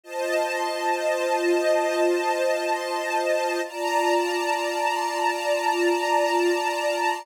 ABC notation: X:1
M:5/4
L:1/8
Q:1/4=83
K:Bb
V:1 name="String Ensemble 1"
[Fcea]10 | [Fdab]10 |]